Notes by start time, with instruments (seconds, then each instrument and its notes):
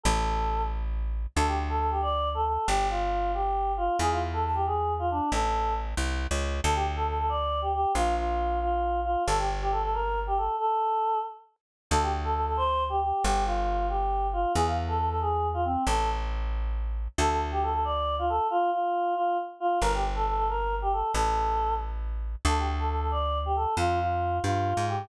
0.03 electric bass (finger) A1, choir aahs A4
1.36 electric bass (finger) D2, choir aahs A4
1.47 choir aahs G4
1.69 choir aahs A4
1.80 choir aahs A4
1.91 choir aahs G4
2.02 choir aahs D5
2.34 choir aahs A4
2.46 choir aahs A4
2.67 electric bass (finger) G1, choir aahs G4
2.90 choir aahs F4
3.34 choir aahs G4
3.77 choir aahs F4
3.99 electric bass (finger) E2, choir aahs G#4
4.11 choir aahs F4
4.33 choir aahs A4
4.45 choir aahs A5
4.55 choir aahs G4
4.66 choir aahs G#4
4.99 choir aahs F4
5.11 choir aahs D4
5.32 electric bass (finger) A1, choir aahs A4
5.97 electric bass (finger) C2
6.31 electric bass (finger) C#2
6.64 electric bass (finger) D2, choir aahs A4
6.75 choir aahs G4
6.96 choir aahs A4
7.07 choir aahs A4
7.19 choir aahs A4
7.29 choir aahs D5
7.62 choir aahs G4
7.74 choir aahs G4
7.95 electric bass (finger) A#1, choir aahs F4
8.17 choir aahs F4
8.62 choir aahs F4
9.04 choir aahs F4
9.27 electric bass (finger) G1, choir aahs A4
9.38 choir aahs G4
9.61 choir aahs G4
9.72 choir aahs A4
9.83 choir aahs A4
9.93 choir aahs A#4
10.27 choir aahs G4
10.37 choir aahs A4
10.59 choir aahs A4
11.91 electric bass (finger) D2, choir aahs A4
12.02 choir aahs G4
12.24 choir aahs A4
12.34 choir aahs A4
12.46 choir aahs A4
12.57 choir aahs C5
12.89 choir aahs G4
13.02 choir aahs G4
13.24 electric bass (finger) G1, choir aahs G4
13.45 choir aahs F4
13.89 choir aahs G4
14.33 choir aahs F4
14.55 electric bass (finger) E2, choir aahs G#4
14.66 choir aahs F5
14.88 choir aahs A4
14.99 choir aahs A4
15.10 choir aahs A4
15.21 choir aahs G#4
15.54 choir aahs F4
15.65 choir aahs C4
15.87 electric bass (finger) A1, choir aahs A4
17.18 electric bass (finger) D2, choir aahs A4
17.30 choir aahs A4
17.52 choir aahs G4
17.63 choir aahs A4
17.73 choir aahs A4
17.84 choir aahs D5
18.19 choir aahs F4
18.29 choir aahs A4
18.50 choir aahs F4
18.72 choir aahs F4
19.15 choir aahs F4
19.60 choir aahs F4
19.81 electric bass (finger) G1, choir aahs A#4
19.94 choir aahs G4
20.16 choir aahs A4
20.27 choir aahs A4
20.37 choir aahs A4
20.49 choir aahs A#4
20.82 choir aahs G4
20.93 choir aahs A4
21.14 electric bass (finger) A1, choir aahs A4
22.45 electric bass (finger) D2, choir aahs A4
22.58 choir aahs G4
22.79 choir aahs A4
22.89 choir aahs A4
23.01 choir aahs A4
23.11 choir aahs D5
23.46 choir aahs G4
23.56 choir aahs A4
23.77 electric bass (finger) F2, choir aahs F4
24.00 choir aahs F4
24.44 electric bass (finger) G2, choir aahs F4
24.77 electric bass (finger) G#2
24.88 choir aahs G4